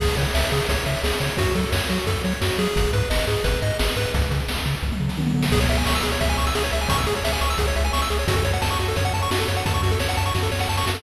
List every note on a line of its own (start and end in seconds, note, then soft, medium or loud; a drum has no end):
0.00 0.09 C#2 medium
0.00 0.16 G#4 loud
0.00 kick loud
0.00 crash loud
0.08 closed hi-hat medium
0.17 0.26 C#3 medium
0.17 0.33 C#5 medium
0.17 closed hi-hat medium
0.25 closed hi-hat medium
0.34 0.44 C#2 medium
0.34 0.50 E5 medium
0.34 snare loud
0.43 closed hi-hat medium
0.52 0.61 C#3 medium
0.52 0.67 G#4 medium
0.52 closed hi-hat medium
0.60 closed hi-hat medium
0.68 0.78 C#2 medium
0.68 0.85 C#5 medium
0.68 kick medium
0.68 closed hi-hat loud
0.77 closed hi-hat medium
0.86 0.96 C#3 medium
0.86 1.01 E5 medium
0.86 closed hi-hat medium
0.95 closed hi-hat medium
1.04 1.13 C#2 medium
1.04 1.19 G#4 medium
1.04 snare loud
1.12 closed hi-hat medium
1.20 1.30 C#3 medium
1.20 1.36 C#5 medium
1.20 closed hi-hat medium
1.29 closed hi-hat medium
1.37 1.47 F#2 medium
1.37 1.54 F#4 loud
1.37 kick loud
1.37 closed hi-hat loud
1.46 closed hi-hat medium
1.55 1.65 F#3 medium
1.55 1.71 A4 medium
1.55 closed hi-hat medium
1.63 closed hi-hat medium
1.72 1.82 F#2 medium
1.72 1.88 C#5 medium
1.72 snare loud
1.81 closed hi-hat medium
1.89 1.99 F#3 medium
1.89 2.05 F#4 medium
1.89 closed hi-hat medium
1.99 closed hi-hat medium
2.07 2.16 F#2 medium
2.07 2.22 A4 medium
2.07 kick medium
2.07 closed hi-hat medium
2.16 closed hi-hat medium
2.24 2.33 F#3 medium
2.24 2.40 C#5 medium
2.24 closed hi-hat medium
2.32 closed hi-hat medium
2.41 2.51 F#2 medium
2.41 2.57 F#4 medium
2.41 snare loud
2.50 closed hi-hat medium
2.58 2.68 F#3 medium
2.58 2.91 G#4 loud
2.58 closed hi-hat medium
2.67 closed hi-hat medium
2.76 2.86 G#1 medium
2.76 kick loud
2.76 closed hi-hat loud
2.85 closed hi-hat medium
2.93 3.03 G#2 medium
2.93 3.09 B4 medium
2.93 closed hi-hat medium
3.01 closed hi-hat medium
3.10 3.20 G#1 medium
3.10 3.26 D#5 medium
3.10 snare loud
3.19 closed hi-hat medium
3.27 3.37 G#2 medium
3.27 3.43 G#4 medium
3.27 closed hi-hat medium
3.36 closed hi-hat medium
3.44 3.54 G#1 medium
3.44 3.60 B4 medium
3.44 kick medium
3.44 closed hi-hat loud
3.54 closed hi-hat medium
3.62 3.72 G#2 medium
3.62 3.78 D#5 medium
3.62 closed hi-hat medium
3.70 closed hi-hat medium
3.79 3.89 G#1 medium
3.79 3.95 G#4 medium
3.79 snare loud
3.87 closed hi-hat medium
3.96 4.06 G#2 medium
3.96 4.12 B4 medium
3.96 closed hi-hat medium
4.05 closed hi-hat medium
4.14 4.24 C#2 medium
4.14 kick loud
4.14 closed hi-hat medium
4.22 closed hi-hat medium
4.31 4.41 C#3 medium
4.31 closed hi-hat medium
4.40 closed hi-hat medium
4.48 4.58 C#2 medium
4.48 snare loud
4.57 closed hi-hat medium
4.66 4.75 C#3 medium
4.66 closed hi-hat medium
4.75 closed hi-hat medium
4.83 4.92 C#2 medium
4.83 kick medium
4.92 mid tom medium
5.00 5.10 C#3 medium
5.09 snare medium
5.17 5.33 D#3 medium
5.17 high tom medium
5.27 mid tom medium
5.34 5.50 D3 medium
5.34 floor tom medium
5.43 snare loud
5.52 5.66 C#2 medium
5.52 5.60 G#4 loud
5.52 kick loud
5.52 crash loud
5.60 5.68 C#5 medium
5.60 closed hi-hat medium
5.69 5.84 C#2 medium
5.69 5.77 E5 medium
5.69 closed hi-hat medium
5.78 5.85 G#5 medium
5.78 closed hi-hat medium
5.86 6.01 C#2 medium
5.86 5.94 C#6 medium
5.86 snare loud
5.94 6.03 E6 medium
5.94 closed hi-hat medium
6.03 6.18 C#2 medium
6.03 6.11 G#4 medium
6.03 closed hi-hat medium
6.12 6.20 C#5 medium
6.12 closed hi-hat medium
6.21 6.35 C#2 medium
6.21 6.28 E5 medium
6.21 kick medium
6.21 closed hi-hat medium
6.29 6.37 G#5 medium
6.29 closed hi-hat medium
6.38 6.53 C#2 medium
6.38 6.45 C#6 medium
6.38 closed hi-hat medium
6.47 6.54 E6 medium
6.47 closed hi-hat medium
6.55 6.70 C#2 medium
6.55 6.63 G#4 loud
6.55 snare loud
6.64 6.72 C#5 medium
6.64 closed hi-hat medium
6.72 6.87 C#2 medium
6.72 6.80 E5 medium
6.72 closed hi-hat medium
6.81 6.89 G#5 medium
6.81 closed hi-hat medium
6.89 7.04 C#2 medium
6.89 6.97 C#6 loud
6.89 kick loud
6.89 closed hi-hat loud
6.98 7.06 E6 medium
6.98 closed hi-hat medium
7.07 7.21 C#2 medium
7.07 7.14 G#4 loud
7.07 closed hi-hat medium
7.15 7.24 C#5 medium
7.15 closed hi-hat medium
7.24 7.39 C#2 medium
7.24 7.32 E5 medium
7.24 snare loud
7.32 7.41 G#5 medium
7.32 closed hi-hat medium
7.41 7.56 C#2 medium
7.41 7.49 C#6 medium
7.41 closed hi-hat medium
7.50 7.58 E6 medium
7.50 closed hi-hat medium
7.58 7.73 C#2 medium
7.58 7.66 G#4 medium
7.58 kick medium
7.58 closed hi-hat loud
7.67 7.75 C#5 medium
7.67 closed hi-hat medium
7.75 7.91 C#2 medium
7.75 7.84 E5 medium
7.75 closed hi-hat medium
7.84 7.92 G#5 medium
7.84 closed hi-hat medium
7.93 8.08 C#2 medium
7.93 8.01 C#6 loud
7.93 snare loud
8.01 8.10 E6 medium
8.01 closed hi-hat medium
8.10 8.25 C#2 medium
8.10 8.18 G#4 medium
8.10 closed hi-hat medium
8.19 8.27 C#5 medium
8.19 closed hi-hat medium
8.28 8.42 F#2 medium
8.28 8.36 F#4 loud
8.28 kick loud
8.28 closed hi-hat loud
8.36 8.44 A4 medium
8.36 closed hi-hat medium
8.45 8.59 F#2 medium
8.45 8.52 C#5 medium
8.45 closed hi-hat medium
8.53 8.61 F#5 medium
8.53 closed hi-hat medium
8.62 8.77 F#2 medium
8.62 8.69 A5 medium
8.62 snare loud
8.71 8.78 C#6 medium
8.71 closed hi-hat medium
8.79 8.94 F#2 medium
8.79 8.87 F#4 medium
8.79 closed hi-hat medium
8.88 8.96 A4 medium
8.88 closed hi-hat medium
8.96 9.11 F#2 medium
8.96 9.05 C#5 medium
8.96 kick medium
8.96 closed hi-hat medium
9.05 9.13 F#5 medium
9.05 closed hi-hat medium
9.14 9.28 F#2 medium
9.14 9.21 A5 medium
9.14 closed hi-hat medium
9.22 9.30 C#6 medium
9.22 closed hi-hat medium
9.31 9.45 F#2 medium
9.31 9.39 F#4 loud
9.31 snare loud
9.40 9.47 A4 medium
9.40 closed hi-hat medium
9.48 9.63 F#2 medium
9.48 9.56 C#5 medium
9.48 closed hi-hat medium
9.57 9.64 F#5 medium
9.57 closed hi-hat medium
9.65 9.80 F#2 medium
9.65 9.74 A5 medium
9.65 kick loud
9.65 closed hi-hat loud
9.74 9.82 C#6 medium
9.74 closed hi-hat medium
9.83 9.98 F#2 medium
9.83 9.91 F#4 medium
9.83 closed hi-hat medium
9.91 9.99 A4 medium
9.91 closed hi-hat medium
9.99 10.15 F#2 medium
9.99 10.08 C#5 medium
9.99 snare loud
10.09 10.16 F#5 medium
10.09 closed hi-hat medium
10.17 10.32 F#2 medium
10.17 10.25 A5 medium
10.17 closed hi-hat medium
10.26 10.33 C#6 medium
10.26 closed hi-hat medium
10.34 10.49 F#2 medium
10.34 10.42 F#4 medium
10.34 kick medium
10.34 snare medium
10.43 10.51 A4 medium
10.43 snare medium
10.52 10.66 F#2 medium
10.52 10.59 C#5 medium
10.52 snare medium
10.59 10.68 F#5 medium
10.59 snare medium
10.69 10.84 F#2 medium
10.69 10.77 A5 medium
10.69 snare medium
10.77 10.85 C#6 medium
10.77 snare medium
10.86 11.01 F#2 medium
10.86 10.94 F#4 medium
10.86 snare loud
10.95 11.02 A4 medium
10.95 snare loud